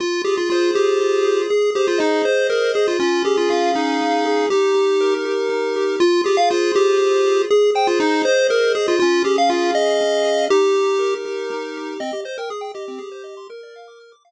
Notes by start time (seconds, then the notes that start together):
0.00 F4
0.24 G4 G#4
0.38 F4
0.50 F4 C5
0.74 G4 G#4
1.00 F4
1.24 G#4
1.50 G#4
1.75 G4 C5
1.88 F4
1.98 D#4 D#5
2.25 C5
2.50 G#4 A#4
2.74 G#4 C5
2.88 F4
2.99 C#4 F4
3.25 G4 G#4
3.37 F4
3.50 F4 F5
3.75 D#4 G#4
4.01 C#4
4.25 G#4
4.50 D#4 G4
4.74 G4
5.01 A#4
5.25 G4
5.49 D#4
5.76 G4
6.00 F4
6.24 G4 G#4
6.37 F5
6.50 F4 C5
6.75 G4 G#4
6.98 F4
7.26 G#4
7.50 G#4
7.75 C5 G5
7.87 F4
8.00 D#4 D#5
8.23 C5
8.49 G#4 A#4
8.75 G#4 C5
8.88 F4
8.99 C#4 F4
9.24 G4 G#4
9.38 F5
9.50 F4 F5
9.75 G#4 D#5
10.01 C#4
10.24 G#4
10.50 D#4 G4
10.75 G4
10.99 A#4
11.25 G4
11.50 D#4
11.77 G4
12.00 C4 D#5
12.13 G4
12.25 C5 D#5
12.38 A#4 G5
12.50 G#4 D#6
12.61 G5
12.74 G4 D#5
12.88 C4
12.98 G#4
13.12 C5
13.24 D#5
13.37 C6
13.50 A#4
13.63 D5
13.76 F5
13.88 D6
14.00 F6
14.12 D6
14.25 F5